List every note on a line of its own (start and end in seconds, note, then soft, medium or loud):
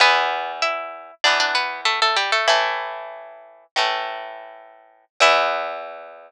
0.00 1.11 E2 medium
0.00 1.11 E3 medium
0.00 0.52 B3 medium
0.00 0.52 B4 medium
0.62 1.14 E4 medium
0.62 1.14 E5 medium
1.24 2.36 E2 medium
1.24 2.36 E3 medium
1.24 2.36 B3 medium
1.24 1.39 D4 medium
1.24 1.39 D5 medium
1.40 1.55 D4 medium
1.40 1.55 D5 medium
1.55 1.81 B3 medium
1.55 1.81 B4 medium
1.85 2.00 A3 medium
1.85 2.00 A4 medium
2.02 2.17 A3 medium
2.02 2.17 A4 medium
2.16 2.31 G3 medium
2.16 2.31 G4 medium
2.32 2.47 A3 medium
2.32 2.47 A4 medium
2.48 3.64 A2 medium
2.48 3.66 E3 medium
2.48 3.64 A3 medium
2.48 3.66 E4 medium
3.76 5.05 A2 medium
3.76 5.05 E3 medium
3.76 5.05 A3 medium
5.20 6.31 E2 loud
5.20 6.31 E3 loud
5.20 6.31 B3 loud
5.20 6.31 E4 loud